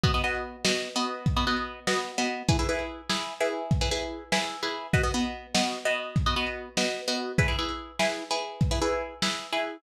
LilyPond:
<<
  \new Staff \with { instrumentName = "Pizzicato Strings" } { \time 6/8 \key b \major \tempo 4. = 98 <b fis' dis''>16 <b fis' dis''>16 <b fis' dis''>4 <b fis' dis''>8. <b fis' dis''>8.~ | <b fis' dis''>16 <b fis' dis''>16 <b fis' dis''>4 <b fis' dis''>8. <b fis' dis''>8. | <e' gis' b'>16 <e' gis' b'>16 <e' gis' b'>4 <e' gis' b'>8. <e' gis' b'>8.~ | <e' gis' b'>16 <e' gis' b'>16 <e' gis' b'>4 <e' gis' b'>8. <e' gis' b'>8. |
<b fis' dis''>16 <b fis' dis''>16 <b fis' dis''>4 <b fis' dis''>8. <b fis' dis''>8.~ | <b fis' dis''>16 <b fis' dis''>16 <b fis' dis''>4 <b fis' dis''>8. <b fis' dis''>8. | <e' gis' b'>16 <e' gis' b'>16 <e' gis' b'>4 <e' gis' b'>8. <e' gis' b'>8.~ | <e' gis' b'>16 <e' gis' b'>16 <e' gis' b'>4 <e' gis' b'>8. <e' gis' b'>8. | }
  \new DrumStaff \with { instrumentName = "Drums" } \drummode { \time 6/8 <hh bd>8. hh8. sn8. hh8. | <hh bd>8. hh8. sn8. hh8. | <hh bd>8. hh8. sn8. hh8. | <hh bd>8. hh8. sn8. hh8. |
<hh bd>8. hh8. sn8. hh8. | <hh bd>8. hh8. sn8. hh8. | <hh bd>8. hh8. sn8. hh8. | <hh bd>8. hh8. sn8. hh8. | }
>>